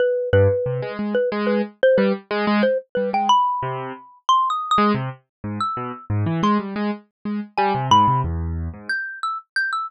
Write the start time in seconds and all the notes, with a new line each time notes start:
0.00 B4
0.33 G2 B4
0.66 C3
0.82 G#3
0.99 G#3
1.15 B4
1.32 G#3
1.47 B4
1.83 C5
1.98 G3 B4
2.31 G#3
2.47 G#3
2.63 C5
2.95 G3 B4
3.13 G#3 G5
3.29 B5
3.63 C3
4.29 C6
4.50 D#6
4.71 D#6
4.78 G#3
4.95 C3
5.44 G#2
5.60 E6
5.77 B2
6.10 G#2
6.26 E3
6.43 G#3 C6
6.59 G3
6.76 G#3
7.25 G#3
7.58 G3 G#5
7.75 C3
7.91 G#2 B5
8.08 C3
8.24 E2
8.74 G#2
8.89 G6
9.23 E6
9.56 G6
9.73 E6